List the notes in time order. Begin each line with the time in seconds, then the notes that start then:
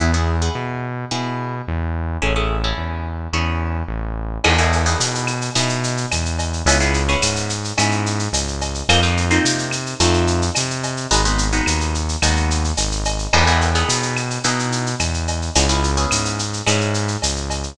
0.00 E2 B3 E4 G#4
0.14 B3 E4 G#4
0.42 B3 E4 G#4
0.55 B2
1.11 B2 B3 E4 G#4
1.68 E2
2.22 A1 C#4 E4 G#4 A4
2.36 C#4 E4 G#4 A4
2.64 C#4 E4 G#4 A4
2.78 E2
3.33 E2 C#4 E4 G#4 A4
3.88 A1
4.44 E2 B3 D#4 E4 G#4, crash, cowbell, claves
4.58 B3 D#4 E4 G#4, shaker
4.72 shaker
4.86 B3 D#4 E4 G#4, shaker
5.00 B2, shaker
5.15 shaker
5.27 claves, shaker
5.41 shaker
5.55 B2 B3 D#4 E4 G#4, cowbell, shaker
5.69 shaker
5.84 shaker
5.97 shaker
6.11 E2, cowbell, claves, shaker
6.25 shaker
6.39 cowbell, shaker
6.53 shaker
6.65 C#2 B3 C#4 E4 G#4, cowbell, shaker
6.80 B3 C#4 E4 G#4, shaker
6.94 shaker
7.09 B3 C#4 E4 G#4, shaker
7.22 G#2, claves, shaker
7.36 shaker
7.49 shaker
7.64 shaker
7.78 G#2 B3 C#4 E4 G#4, cowbell, claves, shaker
7.91 shaker
8.06 shaker
8.19 shaker
8.33 C#2, cowbell, shaker
8.48 shaker
8.61 cowbell, shaker
8.75 shaker
8.89 F2 A#3 C4 D#4 F4, cowbell, claves, shaker
9.03 A#3 C4 D#4 F4, shaker
9.17 shaker
9.30 A#3 C4 D#4 F4, shaker
9.44 C3, shaker
9.58 shaker
9.71 claves, shaker
9.86 shaker
10.00 F2 A3 C4 D#4 F4, cowbell, shaker
10.14 shaker
10.27 shaker
10.42 shaker
10.55 C3, cowbell, claves, shaker
10.70 shaker
10.83 cowbell, shaker
10.97 shaker
11.11 G#1 G#3 B3 D#4 F#4, cowbell, shaker
11.25 G#3 B3 D#4 F#4, shaker
11.38 shaker
11.53 G#3 B3 D#4 F#4, shaker
11.66 D#2, claves, shaker
11.81 shaker
11.94 shaker
12.09 shaker
12.22 D#2 G#3 B3 D#4 F#4, cowbell, claves, shaker
12.36 shaker
12.50 shaker
12.64 shaker
12.77 G#1, cowbell, shaker
12.92 shaker
13.05 cowbell, shaker
13.19 shaker
13.33 E2 B3 D#4 E4 G#4, crash, cowbell, claves
13.47 B3 D#4 E4 G#4, shaker
13.61 shaker
13.75 B3 D#4 E4 G#4, shaker
13.89 B2, shaker
14.02 shaker
14.17 claves, shaker
14.30 shaker
14.44 B2 B3 D#4 E4 G#4, cowbell, shaker
14.59 shaker
14.72 shaker
14.86 shaker
14.99 E2, cowbell, claves, shaker
15.14 shaker
15.28 cowbell, shaker
15.42 shaker
15.55 C#2 B3 C#4 E4 G#4, cowbell, shaker
15.69 B3 C#4 E4 G#4, shaker
15.83 shaker
15.97 B3 C#4 E4 G#4, shaker
16.11 G#2, claves, shaker
16.25 shaker
16.39 shaker
16.53 shaker
16.67 G#2 B3 C#4 E4 G#4, cowbell, claves, shaker
16.81 shaker
16.94 shaker
17.08 shaker
17.22 C#2, cowbell, shaker
17.36 shaker
17.50 cowbell, shaker
17.63 shaker